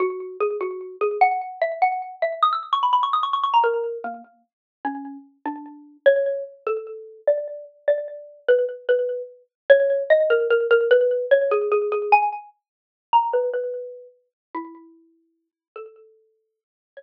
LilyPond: \new Staff { \time 6/8 \key fis \mixolydian \tempo 4. = 99 fis'4 gis'8 fis'4 gis'8 | fis''4 e''8 fis''4 e''8 | dis'''16 e'''16 r16 cis'''16 b''16 b''16 cis'''16 dis'''16 cis'''16 cis'''16 cis'''16 ais''16 | ais'4 ais8 r4. |
\key a \mixolydian cis'4 r8 d'4. | cis''4 r8 a'4. | d''4 r8 d''4. | b'8 r8 b'4 r4 |
\key fis \mixolydian cis''4 dis''8 ais'8 ais'8 ais'8 | b'4 cis''8 gis'8 gis'8 gis'8 | gis''8 r2 ais''8 | b'8 b'4. r4 |
\key a \mixolydian e'2~ e'8 r8 | a'2~ a'8 r8 | cis''2 r4 | }